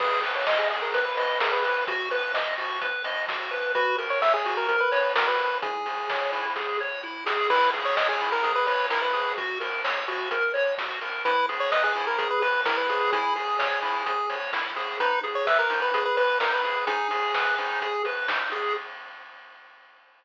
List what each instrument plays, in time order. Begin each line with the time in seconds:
0.00 synth bass 1 G#1, lead 1 (square) G#4 B4, kick, crash
0.23 lead 1 (square) B4, open hi-hat
0.35 lead 1 (square) C#5
0.47 lead 1 (square) D#5, kick, snare
0.58 lead 1 (square) G#4
0.70 lead 1 (square) G#4, open hi-hat
0.82 lead 1 (square) A#4
0.93 synth bass 1 G#1, lead 1 (square) B4, kick, closed hi-hat
1.05 lead 1 (square) B4
1.17 lead 1 (square) B4 D#5, open hi-hat
1.40 lead 1 (square) G#4 A#4, kick, snare
1.52 lead 1 (square) B4
1.64 lead 1 (square) B4, open hi-hat
1.87 synth bass 1 B1, lead 1 (square) F#4, kick, closed hi-hat
2.11 lead 1 (square) B4, open hi-hat
2.34 lead 1 (square) D#5, kick, snare
2.58 lead 1 (square) F#4, open hi-hat
2.81 synth bass 1 B1, lead 1 (square) B4, kick, closed hi-hat
3.04 lead 1 (square) D#5, open hi-hat
3.28 lead 1 (square) F#4, kick, snare
3.51 lead 1 (square) B4, open hi-hat
3.75 synth bass 1 F#2, lead 1 (square) F#4 B4, kick, closed hi-hat
3.98 lead 1 (square) A#4, open hi-hat
4.10 lead 1 (square) C#5
4.22 lead 1 (square) C#5 E5, kick, snare
4.34 lead 1 (square) G#4
4.45 lead 1 (square) F#4, open hi-hat
4.57 lead 1 (square) A#4
4.68 synth bass 1 F#2, lead 1 (square) A#4, kick, closed hi-hat
4.80 lead 1 (square) B4
4.92 lead 1 (square) B4 C#5, open hi-hat
5.16 lead 1 (square) F#4 A#4, kick, snare
5.27 lead 1 (square) B4
5.39 lead 1 (square) A#4, open hi-hat
5.62 synth bass 1 C#2, lead 1 (square) E4 G#4, kick, closed hi-hat
5.86 lead 1 (square) G#4, open hi-hat
6.10 lead 1 (square) C#5, kick, snare
6.32 lead 1 (square) E4, open hi-hat
6.56 synth bass 1 C#2, lead 1 (square) G#4, kick, snare
6.80 lead 1 (square) C#5
7.03 lead 1 (square) E4
7.26 lead 1 (square) G#4, snare
7.50 synth bass 1 C#2, lead 1 (square) E4 B4, kick, crash
7.73 lead 1 (square) G#4, open hi-hat
7.85 lead 1 (square) C#5
7.97 lead 1 (square) C#5 D#5, kick, snare
8.09 lead 1 (square) G#4
8.21 lead 1 (square) E4, open hi-hat
8.32 lead 1 (square) A#4
8.43 synth bass 1 C#2, lead 1 (square) G#4, kick, closed hi-hat
8.55 lead 1 (square) B4
8.67 lead 1 (square) B4 C#5, open hi-hat
8.90 lead 1 (square) E4 A#4, kick, snare
9.02 lead 1 (square) B4
9.13 lead 1 (square) G#4, open hi-hat
9.37 synth bass 1 F#2, lead 1 (square) F#4, kick, closed hi-hat
9.60 lead 1 (square) A#4, open hi-hat
9.84 lead 1 (square) C#5, kick, snare
10.08 lead 1 (square) F#4, open hi-hat
10.31 synth bass 1 F#2, lead 1 (square) A#4, kick, closed hi-hat
10.54 lead 1 (square) C#5, open hi-hat
10.78 lead 1 (square) F#4, kick, snare
11.01 lead 1 (square) A#4, open hi-hat
11.25 synth bass 1 E2, lead 1 (square) E4 B4, kick, closed hi-hat
11.49 lead 1 (square) G#4, open hi-hat
11.60 lead 1 (square) C#5
11.71 lead 1 (square) B4 D#5, kick, snare
11.84 lead 1 (square) G#4
11.95 lead 1 (square) E4, open hi-hat
12.07 lead 1 (square) A#4
12.18 synth bass 1 E2, lead 1 (square) G#4, kick, closed hi-hat
12.30 lead 1 (square) B4
12.41 lead 1 (square) B4, open hi-hat
12.65 lead 1 (square) E4 A#4, kick, snare
12.77 lead 1 (square) B4
12.89 lead 1 (square) G#4, open hi-hat
13.12 synth bass 1 C#2, lead 1 (square) E4 G#4, kick, closed hi-hat
13.36 lead 1 (square) G#4, open hi-hat
13.59 lead 1 (square) C#5, kick, snare
13.82 lead 1 (square) E4, open hi-hat
14.06 synth bass 1 C#2, lead 1 (square) G#4, kick, closed hi-hat
14.30 lead 1 (square) C#5, open hi-hat
14.53 lead 1 (square) E4, kick, snare
14.76 lead 1 (square) G#4, open hi-hat
15.00 synth bass 1 G#1, lead 1 (square) D#4 B4, kick, closed hi-hat
15.23 lead 1 (square) G#4, open hi-hat
15.35 lead 1 (square) C#5
15.47 lead 1 (square) B4 E5, kick, snare
15.59 lead 1 (square) A#4
15.70 lead 1 (square) D#4, open hi-hat
15.82 lead 1 (square) B4
15.93 synth bass 1 G#1, lead 1 (square) G#4, kick, closed hi-hat
16.05 lead 1 (square) B4
16.17 lead 1 (square) B4, open hi-hat
16.40 lead 1 (square) D#4 A#4, kick, snare
16.52 lead 1 (square) B4
16.64 lead 1 (square) G#4, open hi-hat
16.87 synth bass 1 G#1, lead 1 (square) D#4 G#4, kick, closed hi-hat
17.11 lead 1 (square) G#4, open hi-hat
17.34 lead 1 (square) B4, kick, snare
17.58 lead 1 (square) D#4, open hi-hat
17.81 synth bass 1 G#1, lead 1 (square) G#4, kick, closed hi-hat
18.05 lead 1 (square) B4, open hi-hat
18.28 lead 1 (square) D#4, kick, snare
18.52 lead 1 (square) G#4, open hi-hat